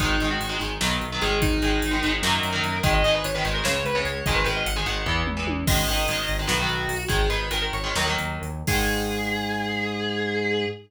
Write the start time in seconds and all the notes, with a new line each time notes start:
0.00 G#1 D#3 G#3 D#4, kick, closed hi-hat
0.20 G#1 D#3 G#3, closed hi-hat
0.30 F#4
0.40 G#1, closed hi-hat
0.49 D#3 G#3
0.59 G#1 D#3 G#3, closed hi-hat
0.81 B1 D#3 F#3 B3, snare
1.01 B1, closed hi-hat
1.12 D#3 F#3 B3
1.22 G#1 D#3 G#3 G#4, closed hi-hat
1.42 D#4, kick, closed hi-hat
1.62 G#1 D#3 G#3, closed hi-hat
1.82 G#1, closed hi-hat
1.91 D#3 G#3
2.03 G#1 D#3 G#3, closed hi-hat
2.22 F#2 D#3 F#3 A#3 A#4, snare
2.43 F#2, closed hi-hat
2.53 D#3 F#3 A#3
2.63 F#2, closed hi-hat
2.83 G#1 D#3 G#3 D#5, kick, closed hi-hat
2.94 D#5
3.04 G#1 D#3 G#3 D#5, closed hi-hat
3.15 B4
3.24 G#1 C#5, closed hi-hat
3.34 D#3 G#3 B4
3.45 G#1 D#3 G#3, closed hi-hat
3.54 A#4
3.64 C#2 C#3 G#3 C#5, snare
3.85 C#2 B4, closed hi-hat
3.95 C#3 G#3 C#5
4.05 C#2 C#5, closed hi-hat
4.26 G#1 D#3 G#3 D#5, kick, closed hi-hat
4.35 B4
4.44 G#1 D#3 G#3 B4, closed hi-hat
4.56 D#5
4.66 G#1 F#5, closed hi-hat
4.76 D#3 G#3 G#5
4.86 G#1 D#3 G#3 F#5, closed hi-hat
5.06 E2 E3 B3, kick
5.26 E2, mid tom
5.37 E3 B3
5.47 E2, high tom
5.67 G#1 D#3 G#3 D#5, kick, crash
5.88 G#1 D#3 G#3, closed hi-hat
6.08 G#1 D#3 G#3, closed hi-hat
6.28 G#1, closed hi-hat
6.39 D#3 G#3
6.47 B1 D#3 F#3 B3 F#4, snare
6.60 D#3 F#3 B3
6.69 B1, closed hi-hat
6.89 B1, open hi-hat
7.08 G#1 D#3 G#3 G#4, kick, closed hi-hat
7.30 G#1 D#3 G#3 B4, closed hi-hat
7.51 G#1 D#3 G#3 A#4, closed hi-hat
7.62 A#4
7.73 G#1 C#5, closed hi-hat
7.84 D#3 G#3
7.95 D#2 D#3 F#3 A#3, snare
8.07 D#3 F#3 A#3
8.18 D#2, closed hi-hat
8.42 D#2, closed hi-hat
8.67 G#2 D#3 G#3 G#4, kick, crash